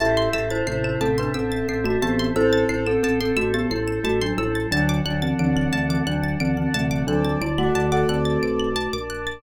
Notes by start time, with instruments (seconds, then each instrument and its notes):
0.00 drawbar organ A1, acoustic grand piano G3 E4, glockenspiel G4 E5, pad 2 (warm) C5 E5 A5, pizzicato strings A5
0.17 pizzicato strings C6
0.33 drawbar organ A1, acoustic grand piano G3 E4, glockenspiel G4 E5, pizzicato strings E6
0.50 glockenspiel E4 C5, pizzicato strings A6
0.67 drawbar organ A1, acoustic grand piano C3 A3, glockenspiel E4 C5, pizzicato strings C7
0.84 glockenspiel E4 C5, pizzicato strings E7
1.01 drawbar organ A1, acoustic grand piano C3 A3, glockenspiel C4 A4, pizzicato strings A5
1.18 glockenspiel D4 B4, pizzicato strings C6
1.34 drawbar organ A1, glockenspiel C4 A4, pizzicato strings E6
1.52 pizzicato strings A6
1.68 drawbar organ A1, glockenspiel C4 A4, pizzicato strings C7
1.84 glockenspiel A3 F#4, pizzicato strings E7
2.02 drawbar organ A1, acoustic grand piano E3 C4, glockenspiel B3 G4, pizzicato strings A5
2.19 pizzicato strings C6
2.36 drawbar organ A1, acoustic grand piano C4 A4, glockenspiel E4 C5, pad 2 (warm) A4 C5 A5, pizzicato strings E6
2.53 pizzicato strings A6
2.69 drawbar organ A1, glockenspiel E4 C5, pizzicato strings C7
2.87 glockenspiel C4 A4, pizzicato strings E7
3.03 drawbar organ A1, glockenspiel C4 A4, pizzicato strings A5
3.21 glockenspiel C4 A4, pizzicato strings C6
3.37 drawbar organ A1, glockenspiel A3 F#4, pizzicato strings E6
3.54 glockenspiel B3 G4, pizzicato strings A6
3.70 drawbar organ A1, glockenspiel G3 E4, pizzicato strings C7
3.88 pizzicato strings E7
4.04 drawbar organ A1, glockenspiel A3 F#4, pizzicato strings A5
4.21 glockenspiel F#3 D4, pizzicato strings C6
4.38 drawbar organ A1, glockenspiel G3 E4, pizzicato strings E6
4.55 pizzicato strings A6
4.71 drawbar organ D2, glockenspiel F#3 D4, acoustic grand piano F#3 D4, pad 2 (warm) D5 F#5 A5, pizzicato strings A5
4.89 pizzicato strings D6
5.05 drawbar organ D2, glockenspiel F#3 D4, acoustic grand piano F#3 D4, pizzicato strings F#6
5.22 glockenspiel E3 C4, pizzicato strings A6
5.39 drawbar organ D2, glockenspiel E3 C4, acoustic grand piano F#3 D4, pizzicato strings D7
5.56 glockenspiel E3 C4, pizzicato strings F#7
5.73 drawbar organ D2, acoustic grand piano C3 A3, glockenspiel E3 C4, pizzicato strings A5
5.89 glockenspiel E3 C4, pizzicato strings D6
6.07 drawbar organ D2, glockenspiel F#3 D4, pizzicato strings F#6
6.23 pizzicato strings A6
6.40 drawbar organ D2, glockenspiel E3 C4, pizzicato strings D7
6.57 glockenspiel E3 C4, pizzicato strings F#7
6.74 drawbar organ D2, acoustic grand piano C3 A3, glockenspiel E3 C4, pizzicato strings A5
6.91 pizzicato strings D6
7.07 drawbar organ D2, glockenspiel F#3 D4, acoustic grand piano C4 A4, pad 2 (warm) D5 A5 D6, pizzicato strings F#6
7.25 glockenspiel F#3 D4, pizzicato strings A6
7.41 drawbar organ D2, glockenspiel G3 E4, pizzicato strings D7
7.58 glockenspiel A3 F#4, acoustic grand piano A4 F#5, pizzicato strings F#7
7.75 drawbar organ D2, pizzicato strings A5
7.92 acoustic grand piano A4 F#5, pizzicato strings D6
8.09 drawbar organ D2, acoustic grand piano C4 A4, pizzicato strings F#6
8.25 pizzicato strings A6
8.43 drawbar organ B1, pizzicato strings D7
8.60 pizzicato strings F#7
8.76 pizzicato strings A5
8.93 drawbar organ A#1, pizzicato strings D6
9.10 pizzicato strings F#6
9.27 pizzicato strings A6